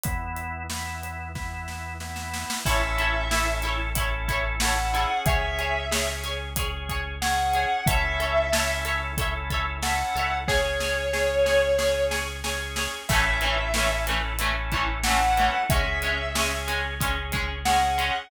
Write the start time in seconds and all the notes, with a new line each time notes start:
0.04 E2 B3 E4, kick, closed hi-hat
0.37 closed hi-hat
0.70 B3 E4, snare
1.03 closed hi-hat
1.35 B3 E4, kick, snare
1.68 snare
2.00 B3 E4, snare
2.16 snare
2.34 snare
2.50 snare
2.65 A1 C#4 E4 A4 C#5 E5, kick, crash
2.98 E4 A4 C#5, closed hi-hat
3.31 C#4 E4 A4 C#5, snare
3.62 E4 A4, closed hi-hat
3.67 C#5
3.95 C#4 E4 A4, kick, closed hi-hat
4.00 C#5
4.28 E4 A4 C#5, kick, closed hi-hat
4.60 C#4 E4 A4 F#5, snare
4.65 C#5
4.94 C#4 E4 G#4 A4 C#5, closed hi-hat
5.26 C#2 G#4 C#5 E5, kick, closed hi-hat
5.59 G#4 C#5, closed hi-hat
5.91 C#4 G#4 C#5, snare
6.24 G#4 C#5, closed hi-hat
6.56 C#4 G#4 C#5, kick, closed hi-hat
6.89 G#4 C#5, kick, closed hi-hat
7.22 C#4 G#4 C#5 F#5, snare
7.54 G#4 C#5, closed hi-hat
7.86 C#2 C#4 E4 A4 C#5 E5, kick, closed hi-hat
7.91 E5
8.20 A4 C#5 E5, closed hi-hat
8.52 C#4 E4 A4 C#5 E5, snare
8.85 A4 C#5 E5, closed hi-hat
9.18 C#4 E4 A4 C#5 E5, kick, closed hi-hat
9.50 A4 C#5 E5, kick, closed hi-hat
9.82 C#4 E4 A4 C#5 F#5, snare
9.87 E5
10.15 C#2 A4 C#5 E5, closed hi-hat
10.48 C#4 G#4 C#5, kick, snare
10.80 G#4 C#5, snare
11.13 C#4 G#4 C#5, snare
11.46 G#4 C#5, snare
11.78 C#4 G#4 C#5, snare
12.11 G#4 C#5, snare
12.44 C#4 G#4 C#5, snare
12.76 G#4 C#5, snare
13.09 A1 E3 A3 C#4 E4 A4 E5, kick, crash
13.41 E3 A3, closed hi-hat
13.45 C#4
13.74 E3 A3 C#4 E4 A4, snare
13.78 C#4
14.07 E3 A3 C#4, closed hi-hat
14.39 E3 A3 C#4 E4 A4, closed hi-hat
14.43 C#4
14.72 E3 A3, kick, closed hi-hat
14.76 C#4
15.04 E3 A3 C#4 E4 A4 F#5, snare
15.08 C#4
15.37 E3 A3 C#4, closed hi-hat
15.70 C#2 G#3 C#4 G#4 E5, kick, closed hi-hat
16.02 G#3 C#4, closed hi-hat
16.35 G#3 C#4 G#4, snare
16.68 G#3 C#4, closed hi-hat
17.00 G#3 C#4 G#4, kick, closed hi-hat
17.32 G#3 C#4, kick, closed hi-hat
17.65 G#3 C#4 G#4 F#5, snare
17.98 G#3 C#4, closed hi-hat